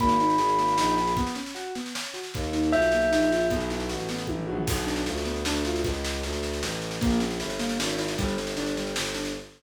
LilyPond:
<<
  \new Staff \with { instrumentName = "Tubular Bells" } { \time 3/4 \key fis \phrygian \tempo 4 = 154 b''2. | r2. | r4 e''2 | r2. |
r2. | r2. | r2. | r2. | }
  \new Staff \with { instrumentName = "Acoustic Grand Piano" } { \time 3/4 \key fis \phrygian ais8 dis'8 gis'8 ais8 dis'8 gis'8 | b8 cis'8 fis'8 b8 cis'8 fis'8 | ais8 dis'8 eis'8 ais8 dis'8 eis'8 | b8 e'8 fis'8 b8 e'8 fis'8 |
b8 d'8 f'8 b8 d'8 f'8 | r2. | ais8 cis'8 e'8 ais8 cis'8 e'8 | g8 c'8 d'8 g8 c'8 d'8 | }
  \new Staff \with { instrumentName = "Violin" } { \clef bass \time 3/4 \key fis \phrygian gis,,4 gis,,4 ais,,4 | r2. | dis,4 b,,4 ais,,4 | b,,4 a,,4 a,,8 ais,,8 |
b,,4 d,4 d,4 | cis,4 d,4 a,,4 | ais,,4 g,,4 gis,,4 | g,,4 g,,4 g,,4 | }
  \new DrumStaff \with { instrumentName = "Drums" } \drummode { \time 3/4 <bd sn>16 sn16 sn16 sn16 sn16 sn16 sn16 sn16 sn16 sn16 sn16 sn16 | <bd sn>16 sn16 sn16 sn16 sn8 sn16 sn16 sn16 sn16 sn16 sn16 | <bd sn>16 sn16 sn16 sn16 sn16 sn16 sn16 sn16 sn16 sn16 sn16 sn16 | <bd sn>16 sn16 sn16 sn16 sn16 sn16 sn16 sn16 <bd tommh>16 tomfh16 tommh16 tomfh16 |
<cymc bd sn>16 sn16 sn16 sn16 sn16 sn16 sn16 sn16 sn16 sn16 sn16 sn16 | <bd sn>16 sn16 sn16 sn16 sn16 sn16 sn16 sn16 sn16 sn16 sn16 sn16 | <bd sn>16 sn16 sn16 sn16 sn16 sn16 sn16 sn16 sn16 sn16 sn16 sn16 | <bd sn>16 sn16 sn16 sn16 sn16 sn16 sn16 sn16 sn16 sn16 sn16 sn16 | }
>>